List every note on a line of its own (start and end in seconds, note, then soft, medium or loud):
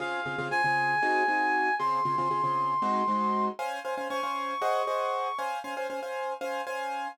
0.00 0.21 C#3 loud
0.00 0.21 C4 medium
0.00 0.21 F4 medium
0.00 0.21 G#4 loud
0.00 0.47 F5 medium
0.26 0.36 C#3 medium
0.26 0.36 C4 medium
0.26 0.36 F4 medium
0.26 0.36 G#4 medium
0.38 0.49 C#3 medium
0.38 0.49 C4 medium
0.38 0.49 F4 medium
0.38 0.49 G#4 medium
0.51 0.62 C#3 medium
0.51 0.62 C4 medium
0.51 0.62 F4 medium
0.51 0.62 G#4 medium
0.51 1.75 G#5 medium
0.64 0.95 C#3 medium
0.64 0.95 C4 medium
0.64 0.95 F4 medium
0.64 0.95 G#4 medium
1.03 1.23 C4 medium
1.03 1.23 D#4 medium
1.03 1.23 F#4 medium
1.03 1.23 G#4 medium
1.28 1.69 C4 medium
1.28 1.69 D#4 medium
1.28 1.69 F#4 medium
1.28 1.69 G#4 medium
1.79 2.00 C#3 medium
1.79 2.00 C4 loud
1.79 2.00 F4 medium
1.79 2.00 G#4 medium
1.79 3.45 C6 medium
2.05 2.15 C#3 medium
2.05 2.15 C4 medium
2.05 2.15 F4 medium
2.05 2.15 G#4 medium
2.18 2.28 C#3 medium
2.18 2.28 C4 medium
2.18 2.28 F4 medium
2.18 2.28 G#4 medium
2.31 2.41 C#3 medium
2.31 2.41 C4 medium
2.31 2.41 F4 medium
2.31 2.41 G#4 medium
2.44 2.74 C#3 medium
2.44 2.74 C4 medium
2.44 2.74 F4 medium
2.44 2.74 G#4 medium
2.82 3.03 G#3 loud
2.82 3.03 C4 medium
2.82 3.03 D#4 medium
2.82 3.03 F#4 loud
3.08 3.49 G#3 medium
3.08 3.49 C4 medium
3.08 3.49 D#4 medium
3.08 3.49 F#4 medium
3.59 3.79 C#4 loud
3.59 3.79 C5 medium
3.59 3.79 F5 medium
3.59 3.79 G#5 medium
3.85 3.95 C#4 medium
3.85 3.95 C5 medium
3.85 3.95 F5 medium
3.85 3.95 G#5 medium
3.97 4.08 C#4 medium
3.97 4.08 C5 medium
3.97 4.08 F5 medium
3.97 4.08 G#5 medium
4.10 4.21 C#4 medium
4.10 4.21 C5 medium
4.10 4.21 F5 medium
4.10 4.21 G#5 medium
4.10 5.37 C#6 medium
4.23 4.54 C#4 medium
4.23 4.54 C5 medium
4.23 4.54 F5 medium
4.23 4.54 G#5 medium
4.62 4.82 G#4 medium
4.62 4.82 C5 medium
4.62 4.82 D#5 medium
4.62 4.82 F#5 medium
4.87 5.28 G#4 medium
4.87 5.28 C5 medium
4.87 5.28 D#5 medium
4.87 5.28 F#5 medium
5.38 5.59 C#4 medium
5.38 5.59 C5 medium
5.38 5.59 F5 medium
5.38 5.59 G#5 medium
5.64 5.74 C#4 medium
5.64 5.74 C5 medium
5.64 5.74 F5 medium
5.64 5.74 G#5 medium
5.77 5.87 C#4 medium
5.77 5.87 C5 medium
5.77 5.87 F5 medium
5.77 5.87 G#5 medium
5.90 6.00 C#4 medium
5.90 6.00 C5 medium
5.90 6.00 F5 medium
5.90 6.00 G#5 medium
6.03 6.33 C#4 medium
6.03 6.33 C5 medium
6.03 6.33 F5 medium
6.03 6.33 G#5 medium
6.41 6.62 C#4 medium
6.41 6.62 C5 medium
6.41 6.62 F5 medium
6.41 6.62 G#5 medium
6.67 7.08 C#4 medium
6.67 7.08 C5 medium
6.67 7.08 F5 medium
6.67 7.08 G#5 medium